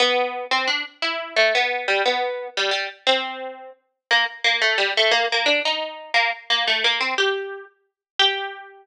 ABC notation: X:1
M:6/8
L:1/8
Q:3/8=117
K:G
V:1 name="Pizzicato Strings"
B,3 C D z | E2 A, B,2 G, | B,3 G, G, z | C4 z2 |
[K:Gm] B, z B, A, G, A, | B, B, D E3 | B, z B, A, B, C | G3 z3 |
G6 |]